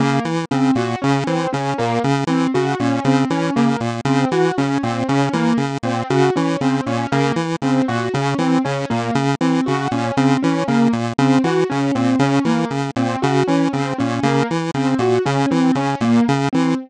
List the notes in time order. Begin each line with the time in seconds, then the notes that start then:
0.00 C#3 A#3
0.25 E3
0.51 C#3 C4
0.75 A#2 F#4
1.02 C#3 C#4
1.27 E3 C4
1.53 C#3 C#4
1.78 A#2 A#3
2.04 C#3
2.27 E3 C4
2.54 C#3 F#4
2.80 A#2 C#4
3.05 C#3 C4
3.30 E3 C#4
3.56 C#3 A#3
3.80 A#2
4.05 C#3 C4
4.31 E3 F#4
4.58 C#3 C#4
4.83 A#2 C4
5.08 C#3 C#4
5.33 E3 A#3
5.57 C#3
5.83 A#2 C4
6.10 C#3 F#4
6.36 E3 C#4
6.61 C#3 C4
6.86 A#2 C#4
7.12 C#3 A#3
7.36 E3
7.62 C#3 C4
7.88 A#2 F#4
8.14 C#3 C#4
8.38 E3 C4
8.64 C#3 C#4
8.90 A#2 A#3
9.15 C#3
9.41 E3 C4
9.66 C#3 F#4
9.91 A#2 C#4
10.17 C#3 C4
10.42 E3 C#4
10.68 C#3 A#3
10.93 A#2
11.18 C#3 C4
11.44 E3 F#4
11.69 C#3 C#4
11.95 A#2 C4
12.19 C#3 C#4
12.45 E3 A#3
12.71 C#3
12.96 A#2 C4
13.22 C#3 F#4
13.47 E3 C#4
13.73 C#3 C4
13.98 A#2 C#4
14.23 C#3 A#3
14.51 E3
14.74 C#3 C4
14.99 A#2 F#4
15.25 C#3 C#4
15.51 E3 C4
15.75 C#3 C#4
16.01 A#2 A#3
16.28 C#3
16.53 E3 C4